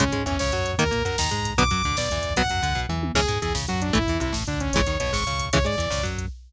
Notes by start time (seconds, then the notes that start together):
0.00 C#2 C#3 G#3 C#4, kick, closed hi-hat
0.07 kick
0.12 G#2 G#3, kick, closed hi-hat
0.20 kick
0.26 E2 E3 C#4, kick, closed hi-hat
0.32 kick
0.39 C#2 C#3 C#5, kick, snare
0.46 kick
0.52 F#2 F#3, kick, closed hi-hat
0.59 kick
0.65 kick, closed hi-hat
0.73 kick
0.78 D#2 D#3 A#3 A#4, kick, closed hi-hat
0.85 kick
0.91 A#2 A#3, kick, closed hi-hat
0.99 kick
1.05 F#2 F#3 A#4, kick, closed hi-hat
1.12 kick
1.18 D#2 D#3 A#5, kick, snare
1.25 kick
1.31 G#2 G#3, kick, closed hi-hat
1.38 kick
1.45 kick, closed hi-hat
1.51 kick
1.58 B1 D3 F#3 B3 D6, kick, closed hi-hat
1.65 kick
1.71 F#2 F#3, kick, closed hi-hat
1.77 kick
1.84 D2 D3, kick, closed hi-hat
1.91 kick
1.96 B1 B2 D5, kick, snare
2.03 kick
2.10 E2 E3, kick, closed hi-hat
2.18 kick
2.23 kick, closed hi-hat
2.30 kick
2.36 B1 F#3 B3 F#5, kick, closed hi-hat
2.44 kick
2.50 F#2 F#3, kick, closed hi-hat
2.56 kick
2.63 D2 D3, kick, closed hi-hat
2.70 kick
2.75 B1 B2, kick, floor tom
2.89 E2 E3, mid tom
3.03 high tom
3.15 C#2 E3 G#3 C#4 G#4, kick, crash
3.21 kick
3.28 G#2 G#3, kick, closed hi-hat
3.36 kick
3.42 E2 E3 G#4, kick, closed hi-hat
3.48 kick
3.54 C#2 C#3, kick, snare
3.62 kick
3.68 F#2 F#3 F#4, kick, closed hi-hat
3.75 kick
3.82 D4, kick, closed hi-hat
3.89 kick
3.93 A1 E3 A3 E4, kick, closed hi-hat
4.01 kick
4.07 E2 E3, kick, closed hi-hat
4.14 kick
4.20 C2 C3 E4, kick, closed hi-hat
4.28 kick
4.32 A1 A2, kick, snare
4.41 kick
4.47 D2 D3 D4, kick, closed hi-hat
4.54 kick
4.60 C#4, kick, closed hi-hat
4.67 kick
4.73 G#1 C#3 E3 G#3 C#5, kick, closed hi-hat
4.81 kick
4.86 D#2 D#3, kick, closed hi-hat
4.94 kick
5.00 B1 B2 C#5, kick, closed hi-hat
5.07 kick
5.13 G#1 G#2 C#6, kick, snare
5.20 kick
5.26 C#2 C#3, kick, closed hi-hat
5.33 kick
5.39 kick, closed hi-hat
5.45 kick
5.53 C#2 C#3 E3 G#3 C#5, kick, closed hi-hat
5.59 kick
5.65 G#2 G#3 D5, kick, closed hi-hat
5.73 kick
5.78 E2 E3, kick, closed hi-hat
5.86 kick
5.90 C#2 C#3, kick, snare
5.98 kick
6.03 F#2 F#3, kick, closed hi-hat
6.13 kick
6.18 kick, closed hi-hat
6.25 kick